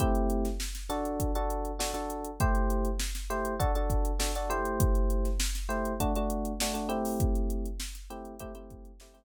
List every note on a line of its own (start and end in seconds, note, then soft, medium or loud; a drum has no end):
0.00 0.47 A3 loud
0.00 0.47 C4 loud
0.00 0.47 E4 loud
0.00 0.47 G4 loud
0.00 kick medium
0.00 closed hi-hat medium
0.15 closed hi-hat medium
0.30 closed hi-hat medium
0.45 snare soft
0.45 closed hi-hat medium
0.60 snare medium
0.75 snare medium
0.75 closed hi-hat medium
0.89 1.31 D4 loud
0.89 1.31 F#4 loud
0.89 1.31 A4 medium
0.89 snare soft
0.89 closed hi-hat medium
1.05 closed hi-hat medium
1.20 kick medium
1.20 closed hi-hat loud
1.35 1.71 D4 medium
1.35 1.71 F#4 medium
1.35 1.71 A4 medium
1.35 closed hi-hat medium
1.50 closed hi-hat medium
1.65 closed hi-hat medium
1.79 1.91 D4 medium
1.79 1.91 F#4 medium
1.79 1.91 A4 medium
1.79 snare loud
1.94 2.30 D4 medium
1.94 2.30 F#4 medium
1.94 2.30 A4 medium
1.94 closed hi-hat medium
2.10 closed hi-hat medium
2.25 closed hi-hat medium
2.40 2.88 A3 loud
2.40 2.88 E4 medium
2.40 2.88 G4 loud
2.40 2.88 C5 medium
2.40 kick loud
2.40 closed hi-hat medium
2.55 closed hi-hat medium
2.70 closed hi-hat medium
2.85 closed hi-hat medium
3.00 snare medium
3.15 snare medium
3.15 closed hi-hat medium
3.30 3.54 A3 medium
3.30 3.54 E4 medium
3.30 3.54 G4 medium
3.30 3.54 C5 medium
3.30 closed hi-hat medium
3.45 closed hi-hat medium
3.60 3.71 D4 loud
3.60 3.71 F#4 loud
3.60 3.71 A4 loud
3.60 kick medium
3.60 closed hi-hat medium
3.75 4.12 D4 medium
3.75 4.12 F#4 medium
3.75 4.12 A4 medium
3.75 closed hi-hat medium
3.90 kick medium
3.90 closed hi-hat medium
4.05 closed hi-hat medium
4.19 4.31 D4 medium
4.19 4.31 F#4 medium
4.19 4.31 A4 medium
4.19 snare loud
4.35 4.50 D4 medium
4.35 4.50 F#4 medium
4.35 4.50 A4 medium
4.35 closed hi-hat medium
4.50 5.28 A3 loud
4.50 5.28 E4 loud
4.50 5.28 G4 medium
4.50 5.28 C5 loud
4.50 closed hi-hat medium
4.65 closed hi-hat medium
4.80 kick loud
4.80 closed hi-hat loud
4.95 closed hi-hat medium
5.10 closed hi-hat medium
5.25 snare soft
5.25 closed hi-hat medium
5.40 snare loud
5.55 snare medium
5.55 closed hi-hat medium
5.69 5.93 A3 medium
5.69 5.93 E4 medium
5.69 5.93 G4 medium
5.69 5.93 C5 medium
5.69 closed hi-hat medium
5.85 closed hi-hat medium
6.00 6.12 A3 loud
6.00 6.12 D4 loud
6.00 6.12 F#4 loud
6.00 kick medium
6.00 closed hi-hat loud
6.16 6.52 A3 medium
6.16 6.52 D4 medium
6.16 6.52 F#4 medium
6.16 closed hi-hat medium
6.30 closed hi-hat medium
6.45 closed hi-hat medium
6.60 6.73 A3 medium
6.60 6.73 D4 medium
6.60 6.73 F#4 medium
6.60 snare loud
6.74 6.88 A3 medium
6.74 6.88 D4 medium
6.74 6.88 F#4 medium
6.74 closed hi-hat medium
6.89 7.67 A3 loud
6.89 7.67 C4 medium
6.89 7.67 E4 loud
6.89 7.67 G4 medium
6.89 closed hi-hat medium
7.05 open hi-hat medium
7.20 kick loud
7.20 closed hi-hat medium
7.35 closed hi-hat medium
7.50 closed hi-hat medium
7.66 closed hi-hat medium
7.80 snare loud
7.95 snare soft
7.95 closed hi-hat medium
8.10 8.34 A3 medium
8.10 8.34 C4 medium
8.10 8.34 E4 medium
8.10 8.34 G4 medium
8.10 closed hi-hat medium
8.25 closed hi-hat medium
8.39 8.52 A3 loud
8.39 8.52 C4 medium
8.39 8.52 E4 medium
8.39 8.52 G4 loud
8.39 kick medium
8.39 closed hi-hat loud
8.55 8.91 A3 medium
8.55 8.91 C4 medium
8.55 8.91 E4 medium
8.55 8.91 G4 medium
8.55 closed hi-hat medium
8.70 kick medium
8.70 closed hi-hat medium
8.85 closed hi-hat medium
9.00 9.13 A3 medium
9.00 9.13 C4 medium
9.00 9.13 E4 medium
9.00 9.13 G4 medium
9.00 snare loud
9.14 9.24 A3 medium
9.14 9.24 C4 loud
9.14 9.24 E4 medium
9.14 9.24 G4 medium
9.14 closed hi-hat medium